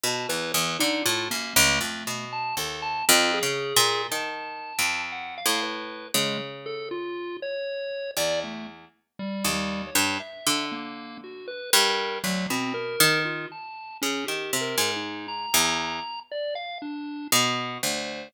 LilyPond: <<
  \new Staff \with { instrumentName = "Orchestral Harp" } { \clef bass \time 6/4 \tempo 4 = 59 b,16 e,16 e,16 d16 a,16 fis,16 cis,16 f,16 b,8 dis,8 \tuplet 3/2 { f,8 cis8 ais,8 dis4 f,4 a,4 } | cis2 e,8. r8 dis,8 g,16 r16 d4~ d16 g,8 | d,16 b,8 dis8 r8 cis16 dis16 c16 gis,8. e,8 r4 r16 b,8 d,8 | }
  \new Staff \with { instrumentName = "Lead 1 (square)" } { \time 6/4 a''16 b'16 b'16 dis'16 f'16 ais16 a8. a''16 a'16 a''16 f'16 gis'8. a''4 fis''16 f''16 b'8 | gis16 r16 a'16 f'8 cis''8. d''16 a16 r8 \tuplet 3/2 { g8 g8 cis''8 } e''8 ais8 fis'16 b'16 ais'8 | fis16 c'16 ais'8 f'16 a''8 cis'16 \tuplet 3/2 { g'8 ais'8 dis'8 } ais''4 d''16 f''16 d'8 fis''8 c''8 | }
>>